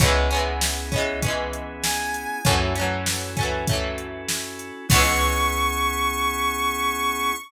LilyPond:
<<
  \new Staff \with { instrumentName = "Lead 1 (square)" } { \time 4/4 \key cis \minor \tempo 4 = 98 r2. gis''4 | r1 | cis'''1 | }
  \new Staff \with { instrumentName = "Acoustic Guitar (steel)" } { \time 4/4 \key cis \minor <e gis b cis'>8 <e gis b cis'>4 <e gis b cis'>8 <e gis b cis'>2 | <e fis a cis'>8 <e fis a cis'>4 <e fis a cis'>8 <e fis a cis'>2 | <e gis b cis'>1 | }
  \new Staff \with { instrumentName = "Drawbar Organ" } { \time 4/4 \key cis \minor <b cis' e' gis'>1 | <cis' e' fis' a'>1 | <b cis' e' gis'>1 | }
  \new Staff \with { instrumentName = "Electric Bass (finger)" } { \clef bass \time 4/4 \key cis \minor cis,1 | fis,1 | cis,1 | }
  \new DrumStaff \with { instrumentName = "Drums" } \drummode { \time 4/4 <hh bd>8 hh8 sn8 <hh bd>8 <hh bd>8 hh8 sn8 hh8 | <hh bd>8 hh8 sn8 <hh bd>8 <hh bd>8 hh8 sn8 hh8 | <cymc bd>4 r4 r4 r4 | }
>>